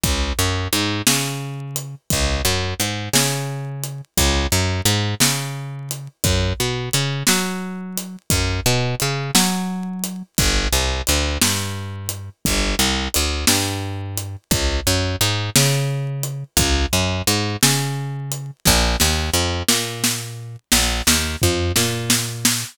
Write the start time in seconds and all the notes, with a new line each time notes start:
0.03 C#2, kick, closed hi-hat
0.39 F#2
0.73 G#2, closed hi-hat
1.07 C#3, snare
1.76 closed hi-hat
2.10 C#2, kick, closed hi-hat
2.45 F#2
2.80 G#2, closed hi-hat
3.13 C#3, snare
3.84 closed hi-hat
4.17 C#2, kick, closed hi-hat
4.52 F#2
4.85 G#2, closed hi-hat
5.20 C#3, snare
5.91 closed hi-hat
6.24 F#2, kick, closed hi-hat
6.60 B2
6.93 C#3, closed hi-hat
7.27 F#3, snare
7.98 closed hi-hat
8.30 F#2, kick, closed hi-hat
8.66 B2
9.00 C#3, closed hi-hat
9.35 F#3, snare
10.04 closed hi-hat
10.38 G1, kick, closed hi-hat
10.73 C2
11.07 D2, closed hi-hat
11.42 G2, snare
12.09 closed hi-hat
12.45 G1, kick, closed hi-hat
12.79 C2
13.14 D2, closed hi-hat
13.47 G2, snare
14.18 closed hi-hat
14.51 C#2, kick, closed hi-hat
14.87 F#2
15.21 G#2, closed hi-hat
15.56 C#3, snare
16.23 closed hi-hat
16.57 C#2, kick, closed hi-hat
16.93 F#2
17.27 G#2, closed hi-hat
17.63 C#3, snare
18.32 closed hi-hat
18.65 A#1, kick, snare
19.00 D#2, snare
19.33 F2
19.68 A#2, snare
20.04 snare
20.72 A#1, snare
21.07 D#2, snare
21.42 F2, floor tom
21.76 A#2, snare
22.10 snare
22.45 snare